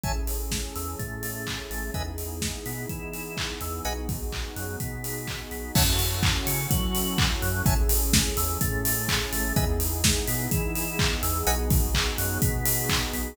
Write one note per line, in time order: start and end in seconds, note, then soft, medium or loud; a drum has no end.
0.03 0.65 A1 medium
0.03 1.94 C#4 medium
0.03 1.94 E4 medium
0.03 1.94 G#4 medium
0.03 1.94 A4 medium
0.03 0.12 C#5 medium
0.03 0.12 E5 loud
0.03 0.12 G#5 loud
0.03 0.12 A5 loud
0.03 kick loud
0.03 closed hi-hat medium
0.27 open hi-hat medium
0.51 kick medium
0.51 snare loud
0.75 0.96 E2 medium
0.75 0.96 E3 medium
0.75 open hi-hat medium
0.99 1.60 A2 medium
0.99 1.60 A3 medium
0.99 kick medium
0.99 closed hi-hat medium
1.23 open hi-hat medium
1.47 kick medium
1.47 clap loud
1.70 1.91 A1 medium
1.70 1.91 A3 medium
1.70 open hi-hat medium
1.94 2.55 E2 medium
1.94 3.83 B3 medium
1.94 3.83 D#4 medium
1.94 3.85 E4 medium
1.94 3.83 G#4 medium
1.94 2.03 B4 medium
1.94 2.03 D#5 loud
1.94 2.03 E5 medium
1.94 2.03 G#5 medium
1.94 kick medium
1.94 closed hi-hat medium
2.18 open hi-hat medium
2.42 kick medium
2.42 snare loud
2.66 2.86 B2 medium
2.66 2.86 B3 medium
2.66 open hi-hat medium
2.89 3.50 E3 medium
2.89 3.50 E4 medium
2.89 kick medium
2.89 closed hi-hat medium
3.13 open hi-hat medium
3.37 kick medium
3.37 clap loud
3.61 3.81 E2 medium
3.61 3.81 E3 medium
3.61 open hi-hat medium
3.84 4.46 B1 medium
3.84 5.72 B3 medium
3.84 5.72 D#4 medium
3.84 5.72 F#4 medium
3.84 5.72 G#4 medium
3.84 3.93 B4 medium
3.84 3.93 D#5 loud
3.84 3.93 F#5 medium
3.84 3.93 G#5 loud
3.84 closed hi-hat loud
4.09 kick loud
4.09 open hi-hat medium
4.32 kick medium
4.32 clap loud
4.56 4.76 F#2 medium
4.56 4.76 F#3 medium
4.56 open hi-hat medium
4.80 5.41 B2 medium
4.80 5.41 B3 medium
4.80 kick medium
4.80 closed hi-hat loud
5.04 open hi-hat medium
5.27 kick medium
5.27 clap loud
5.51 5.72 B1 medium
5.51 5.72 B3 medium
5.51 open hi-hat medium
5.75 6.36 F#2 loud
5.75 7.64 C#4 medium
5.75 7.64 E4 medium
5.75 7.64 F#4 loud
5.75 7.64 A4 medium
5.75 5.84 C#5 loud
5.75 5.84 E5 loud
5.75 5.84 F#5 loud
5.75 5.84 A5 loud
5.75 kick loud
5.75 crash loud
5.99 open hi-hat loud
6.23 kick loud
6.23 clap loud
6.47 6.67 C#3 loud
6.47 6.67 C#4 medium
6.47 open hi-hat loud
6.71 7.31 F#3 loud
6.71 7.31 F#4 medium
6.71 kick loud
6.71 closed hi-hat loud
6.95 open hi-hat loud
7.18 kick loud
7.18 clap loud
7.42 7.62 F#2 loud
7.42 7.62 F#3 loud
7.42 open hi-hat medium
7.65 8.27 A1 loud
7.65 9.54 C#4 medium
7.65 9.54 E4 medium
7.65 9.54 G#4 medium
7.65 9.54 A4 medium
7.65 7.74 C#5 loud
7.65 7.74 E5 loud
7.65 7.74 G#5 loud
7.65 7.74 A5 loud
7.65 kick loud
7.65 closed hi-hat loud
7.89 open hi-hat loud
8.13 kick loud
8.13 snare loud
8.37 8.57 E2 loud
8.37 8.57 E3 medium
8.37 open hi-hat loud
8.61 9.22 A2 loud
8.61 9.22 A3 medium
8.61 kick loud
8.61 closed hi-hat loud
8.85 open hi-hat loud
9.08 kick loud
9.08 clap loud
9.32 9.53 A1 loud
9.32 9.53 A3 loud
9.32 open hi-hat loud
9.56 10.17 E2 loud
9.56 11.45 B3 medium
9.56 11.45 D#4 loud
9.56 11.45 E4 medium
9.56 11.45 G#4 loud
9.56 9.65 B4 loud
9.56 9.65 D#5 loud
9.56 9.65 E5 loud
9.56 9.65 G#5 loud
9.56 kick loud
9.56 closed hi-hat loud
9.80 open hi-hat loud
10.04 kick loud
10.04 snare loud
10.27 10.48 B2 loud
10.27 10.48 B3 medium
10.27 open hi-hat loud
10.51 11.12 E3 loud
10.51 11.12 E4 loud
10.51 kick loud
10.51 closed hi-hat loud
10.75 open hi-hat loud
10.99 kick loud
10.99 clap loud
11.23 11.43 E2 loud
11.23 11.43 E3 loud
11.23 open hi-hat loud
11.45 12.07 B1 loud
11.45 13.34 B3 loud
11.45 13.34 D#4 loud
11.45 13.34 F#4 medium
11.45 13.34 G#4 medium
11.45 11.55 B4 loud
11.45 11.55 D#5 loud
11.45 11.55 F#5 loud
11.45 11.55 G#5 loud
11.45 closed hi-hat loud
11.70 kick loud
11.70 open hi-hat loud
11.94 kick loud
11.94 clap loud
12.18 12.38 F#2 loud
12.18 12.38 F#3 loud
12.18 open hi-hat loud
12.42 13.03 B2 loud
12.42 13.03 B3 medium
12.42 kick loud
12.42 closed hi-hat loud
12.65 open hi-hat loud
12.89 kick loud
12.89 clap loud
13.13 13.34 B1 medium
13.13 13.34 B3 medium
13.13 open hi-hat medium